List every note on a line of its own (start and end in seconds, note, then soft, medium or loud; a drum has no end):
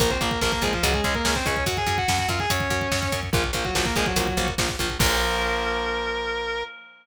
0.00 0.18 A#1 loud
0.00 0.08 F3 medium
0.00 0.08 A#3 loud
0.00 0.10 A#3 medium
0.00 0.10 A#4 loud
0.00 kick medium
0.00 closed hi-hat medium
0.10 0.20 C4 medium
0.10 0.20 C5 medium
0.10 kick medium
0.21 0.39 A#1 medium
0.21 0.29 F3 medium
0.21 0.29 A#3 medium
0.21 0.39 A#3 medium
0.21 0.39 A#4 medium
0.21 kick medium
0.21 closed hi-hat medium
0.31 kick medium
0.41 0.60 A#1 medium
0.41 0.50 F3 medium
0.41 0.52 A#3 medium
0.41 0.50 A#3 medium
0.41 0.52 A#4 medium
0.41 kick medium
0.41 snare medium
0.52 0.62 A#3 medium
0.52 0.62 A#4 medium
0.52 kick medium
0.62 0.79 A#1 medium
0.62 0.71 F3 medium
0.62 0.72 G#3 medium
0.62 0.71 A#3 medium
0.62 0.72 G#4 medium
0.62 kick medium
0.62 closed hi-hat medium
0.73 0.83 F3 medium
0.73 0.83 F4 medium
0.73 kick medium
0.83 1.01 C#2 loud
0.83 0.93 F#3 medium
0.83 0.91 G#3 medium
0.83 0.91 C#4 loud
0.83 0.93 F#4 medium
0.83 kick medium
0.83 closed hi-hat medium
0.94 1.04 G#3 medium
0.94 1.04 G#4 medium
0.94 kick medium
1.04 1.22 C#2 medium
1.04 1.14 G#3 medium
1.04 1.13 G#3 medium
1.04 1.13 C#4 medium
1.04 1.14 G#4 medium
1.04 kick medium
1.04 closed hi-hat medium
1.15 1.34 A#3 medium
1.15 1.34 A#4 medium
1.15 kick medium
1.25 1.43 C#2 medium
1.25 1.33 G#3 medium
1.25 1.33 C#4 medium
1.25 kick medium
1.25 snare loud
1.35 1.45 C4 medium
1.35 1.45 C5 medium
1.35 kick medium
1.46 1.64 C#2 medium
1.46 1.54 G#3 medium
1.46 1.54 C#4 medium
1.46 1.64 C#4 medium
1.46 1.64 C#5 medium
1.46 kick medium
1.46 closed hi-hat medium
1.56 kick medium
1.66 1.84 F#2 medium
1.66 1.77 F#4 medium
1.66 1.77 F#5 medium
1.66 kick medium
1.66 closed hi-hat medium
1.77 1.97 G#4 medium
1.77 1.97 G#5 medium
1.77 kick medium
1.86 2.04 F#2 medium
1.86 kick medium
1.86 closed hi-hat medium
1.98 2.17 F#4 medium
1.98 2.17 F#5 medium
1.98 kick medium
2.08 2.26 F#2 medium
2.08 kick medium
2.08 snare loud
2.18 2.29 F#4 medium
2.18 2.29 F#5 medium
2.18 kick medium
2.28 2.46 F#2 medium
2.28 2.39 F4 medium
2.28 2.39 F5 medium
2.28 kick medium
2.28 closed hi-hat medium
2.40 2.49 G#4 medium
2.40 2.49 G#5 medium
2.40 kick medium
2.50 2.68 F#2 medium
2.50 3.20 C#4 medium
2.50 3.20 C#5 medium
2.50 kick medium
2.50 closed hi-hat loud
2.60 kick medium
2.70 2.88 F#2 medium
2.70 kick medium
2.70 closed hi-hat medium
2.81 kick medium
2.92 3.09 F#2 medium
2.92 kick medium
2.92 snare medium
3.02 kick medium
3.12 3.30 F#2 medium
3.12 kick medium
3.12 closed hi-hat medium
3.23 kick medium
3.33 3.52 A#1 loud
3.33 3.41 F3 medium
3.33 3.43 F3 medium
3.33 3.41 A#3 medium
3.33 3.43 F4 medium
3.33 kick loud
3.44 kick medium
3.53 3.71 A#1 medium
3.53 3.63 F3 medium
3.53 3.63 A#3 medium
3.53 kick medium
3.53 closed hi-hat medium
3.65 3.74 F#3 medium
3.65 3.74 F#4 medium
3.65 kick medium
3.75 3.93 A#1 medium
3.75 3.84 F3 medium
3.75 3.85 F#3 medium
3.75 3.84 A#3 medium
3.75 3.85 F#4 medium
3.75 kick medium
3.75 snare loud
3.85 3.95 A#3 medium
3.85 3.95 A#4 medium
3.85 kick medium
3.96 4.14 A#1 medium
3.96 4.04 F3 medium
3.96 4.06 G#3 medium
3.96 4.04 A#3 medium
3.96 4.06 G#4 medium
3.96 kick medium
3.96 closed hi-hat medium
4.06 4.49 F#3 medium
4.06 4.49 F#4 medium
4.06 kick medium
4.16 4.34 A#1 medium
4.16 4.26 F3 medium
4.16 4.26 A#3 medium
4.16 kick medium
4.16 closed hi-hat loud
4.27 kick medium
4.37 4.55 A#1 medium
4.37 4.46 F3 medium
4.37 4.46 A#3 medium
4.37 kick medium
4.37 closed hi-hat medium
4.48 kick medium
4.58 4.76 A#1 medium
4.58 4.67 F3 medium
4.58 4.67 A#3 medium
4.58 kick medium
4.58 snare loud
4.69 kick medium
4.79 4.98 A#1 medium
4.79 4.88 F3 medium
4.79 4.88 A#3 medium
4.79 kick medium
4.79 closed hi-hat medium
4.90 kick medium
4.99 6.64 A#1 loud
4.99 6.63 F3 loud
4.99 6.63 A#3 loud
4.99 6.63 A#4 loud
4.99 kick loud
4.99 crash loud